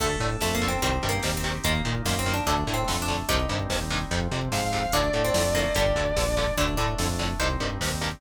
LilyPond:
<<
  \new Staff \with { instrumentName = "Distortion Guitar" } { \time 4/4 \key d \phrygian \tempo 4 = 146 r1 | r1 | r2. f''4 | d''1 |
r1 | }
  \new Staff \with { instrumentName = "Harpsichord" } { \time 4/4 \key d \phrygian a8 r8 \tuplet 3/2 { a8 bes8 c'8 c'4 bes4 c'4 } | bes8 r8 \tuplet 3/2 { bes8 c'8 d'8 d'4 c'4 d'4 } | <ees' g'>1 | d'8. c'8. bes8 g4. r8 |
d'8 d'4. c''2 | }
  \new Staff \with { instrumentName = "Overdriven Guitar" } { \time 4/4 \key d \phrygian <d a>8 <d a>8 <d a>8 <d a>8 <c ees g>8 <c ees g>8 <c ees g>8 <c ees g>8 | <bes, ees>8 <bes, ees>8 <bes, ees>8 <bes, ees>8 <a, d>8 <a, d>8 <a, d>8 <a, d>8 | <g, c ees>8 <g, c ees>8 <g, c ees>8 <g, c ees>8 <f, c>8 <f, c>8 <f, c>8 <f, c>8 | <a, d>8 <a, d>8 <a, d>8 <a, d>8 <g, d>8 <g, d>8 <g, d>8 <g, d>8 |
<a, d>8 <a, d>8 <a, d>8 <a, d>8 <g, c ees>8 <g, c ees>8 <g, c ees>8 <g, c ees>8 | }
  \new Staff \with { instrumentName = "Synth Bass 1" } { \clef bass \time 4/4 \key d \phrygian d,8 a,8 f,4 c,8 g,8 ees,4 | ees,8 bes,8 ges,4 d,8 a,8 f,4 | c,8 g,8 ees,4 f,8 c8 aes,4 | d,8 a,8 f,4 g,,8 d,8 bes,,4 |
d,8 a,8 f,4 c,8 g,8 ees,4 | }
  \new Staff \with { instrumentName = "Drawbar Organ" } { \time 4/4 \key d \phrygian <d' a'>2 <c' ees' g'>2 | <bes ees'>2 <a d'>2 | <g c' ees'>2 <f c'>2 | <a d'>2 <g d'>2 |
<a d'>2 <g c' ees'>2 | }
  \new DrumStaff \with { instrumentName = "Drums" } \drummode { \time 4/4 <cymc bd>16 bd16 <hh bd>16 bd16 <bd sn>16 bd16 <hh bd>16 bd16 <hh bd>16 bd16 <hh bd>16 bd16 <bd sn>16 bd16 <hh bd>16 bd16 | <hh bd>16 bd16 <hh bd>16 bd16 <bd sn>16 bd16 <hh bd>16 bd16 <hh bd>16 bd16 <hh bd>16 bd16 <bd sn>16 bd16 <hh bd>16 bd16 | <hh bd>16 bd16 <hh bd>16 bd16 <bd sn>16 bd16 <hh bd>16 bd16 <hh bd>16 bd16 <hh bd>16 bd16 <bd sn>16 bd16 <hh bd>16 bd16 | <hh bd>16 bd16 <hh bd>16 bd16 <bd sn>16 bd16 <hh bd>16 bd16 <hh bd>16 bd16 <hh bd>16 bd16 <bd sn>16 bd16 <hh bd>16 bd16 |
<hh bd>16 bd16 <hh bd>16 bd16 <bd sn>16 bd16 <hh bd>16 bd16 <hh bd>16 bd16 <hh bd>16 bd16 <bd sn>16 bd16 <hh bd>16 bd16 | }
>>